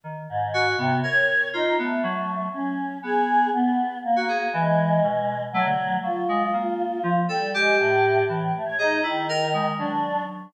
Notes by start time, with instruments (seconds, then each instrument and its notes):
0.04 electric piano 2 D#3
0.29 choir aahs G#2
0.54 electric piano 2 F#4
0.78 choir aahs C3, electric piano 2 B3
1.03 electric piano 2 A#4, choir aahs C#5
1.53 choir aahs D#4, electric piano 2 F4
1.78 choir aahs A3, electric piano 2 B3
2.03 electric piano 2 F#3
2.53 choir aahs C#4
3.03 electric piano 2 B3, choir aahs G#4
3.53 choir aahs B3
4.04 choir aahs A#3
4.16 electric piano 2 F#4
4.28 electric piano 2 G#4
4.52 electric piano 2 E3, choir aahs G#3
5.03 electric piano 2 B2
5.53 choir aahs F#3, electric piano 2 A3
5.66 electric piano 2 D3
6.03 electric piano 2 F#3, choir aahs F4
6.29 electric piano 2 G#3
6.53 electric piano 2 A#3
7.03 electric piano 2 F3
7.29 choir aahs G3, electric piano 2 A4
7.54 choir aahs G#3, electric piano 2 G4
7.79 choir aahs A2
8.29 choir aahs A2, electric piano 2 E3
8.55 choir aahs A3
8.66 choir aahs C#5
8.79 choir aahs D#4, electric piano 2 G#4
9.03 choir aahs D#3, electric piano 2 E4
9.29 electric piano 2 A#4
9.54 electric piano 2 G#3
9.79 electric piano 2 F#3, choir aahs D4